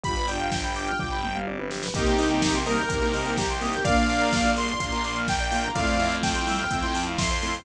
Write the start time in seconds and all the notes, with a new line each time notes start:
0.03 G1 B3 D4 F4 G4 B5, kick, closed hi-hat
0.16 B4, closed hi-hat
0.28 D4 F4 D5 G5, open hi-hat
0.40 F5, closed hi-hat
0.52 G5, kick, snare
0.64 B5, closed hi-hat
0.75 D4 F4 D6, open hi-hat
0.87 F6, closed hi-hat
0.99 G1 D6, kick, floor tom
1.11 B5
1.23 G5, mid tom
1.35 F5, mid tom
1.47 D5, high tom
1.59 B4, high tom
1.71 G4, snare
1.83 B4, snare
1.94 C2 A#3 C4 D#4 G4 A#4 C5 D#5 G5, kick, closed hi-hat
2.06 C5, closed hi-hat
2.18 A#3 C4 D#4 G4 D#5, open hi-hat
2.30 G5, closed hi-hat
2.42 A#3 C4 D#4 G4 A#5, kick, snare
2.54 A#3 C4 D#4 G4 C6, closed hi-hat
2.65 G3 A#3 C4 D#4 G4 A#4 D#6, open hi-hat
2.78 G6, closed hi-hat
2.89 C2 A#3 C4 D#4 G4 A#4, kick, closed hi-hat
3.02 A#3 C4 D#4 G4 C5, closed hi-hat
3.14 D#5, open hi-hat
3.25 G5, closed hi-hat
3.37 G4 A#5, kick, snare
3.49 C6, closed hi-hat
3.61 A#3 C4 D#4 G4 D#6, open hi-hat
3.73 G6, closed hi-hat
3.84 A#1 A#3 D4 F4 A#4 D5 F5, kick, closed hi-hat
3.97 D5, closed hi-hat
4.09 A#3 D4 F4 F5, open hi-hat
4.21 A#5, closed hi-hat
4.33 A#3 D4 F4 D6, kick, snare
4.45 A#3 D4 F4 F6, closed hi-hat
4.56 G3 A#3 D4 F4 A#4 C6, open hi-hat
4.68 D5, closed hi-hat
4.80 A#1 A#3 D4 F4 F5, kick, closed hi-hat
4.92 A#3 D4 F4 A#5, closed hi-hat
5.04 D6, open hi-hat
5.16 F6, closed hi-hat
5.28 A#4 G5, kick, snare
5.40 D5, closed hi-hat
5.51 A#3 D4 F4 F5, open hi-hat
5.64 A#5, closed hi-hat
5.75 F2 A3 C4 E4 F4 A4 D5 F5, kick, closed hi-hat
5.87 C5, closed hi-hat
5.99 A3 C4 E4 F4 E5, open hi-hat
6.11 F5, closed hi-hat
6.23 A3 C4 E4 F4 G5 A5, kick, snare
6.35 A3 C4 E4 F4 C6, closed hi-hat
6.46 E3 G3 A3 C4 E4 F4 E6, open hi-hat
6.59 F6, closed hi-hat
6.71 F2 A3 C4 E4 F4 E6, kick, closed hi-hat
6.83 A3 C4 E4 F4 C6, closed hi-hat
6.95 A5, open hi-hat
7.06 F5, closed hi-hat
7.18 E5 C6, kick, snare
7.30 C5, closed hi-hat
7.42 A3 C4 E4 F4 A4, open hi-hat
7.54 C5, open hi-hat